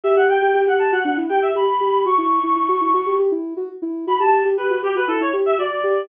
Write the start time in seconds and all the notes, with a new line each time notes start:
0.04 G4 E5
0.16 G4 F#5
0.29 G5
0.42 G4
0.54 G4
0.67 G4 F#5
0.79 G4 A5
0.92 F#4 F#5
1.05 D4 F#5
1.17 E4
1.29 G4 G5
1.42 E5
1.55 G4 B5
1.80 G4
2.05 F#4 C#6
2.18 E4
2.43 E4
2.56 E4
2.68 F#4
2.81 E4
2.94 F#4
3.06 G4
3.19 G4
3.32 E4
3.57 F#4
3.82 E4
4.07 F#4 B5
4.20 G4 A5
4.45 G4
4.57 G4 B4
4.70 F#4
4.83 G4
4.95 F#4 B4
5.08 E4 A4
5.20 E4 C#5
5.33 G4
5.46 E5
5.58 F#4 D5
5.84 G4